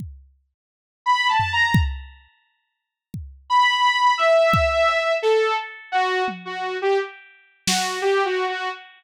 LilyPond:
<<
  \new Staff \with { instrumentName = "Lead 2 (sawtooth)" } { \time 5/8 \tempo 4 = 86 r4. \tuplet 3/2 { b''8 a''8 bes''8 } | r2 r8 | b''4 e''4. | a'8 r8 ges'8 r16 ges'8 g'16 |
r4 ges'8 \tuplet 3/2 { g'8 ges'8 ges'8 } | }
  \new DrumStaff \with { instrumentName = "Drums" } \drummode { \time 5/8 bd4. r8 tomfh8 | bd4. r8 bd8 | r4. bd8 cb8 | hc4. tommh4 |
r4 sn8 r4 | }
>>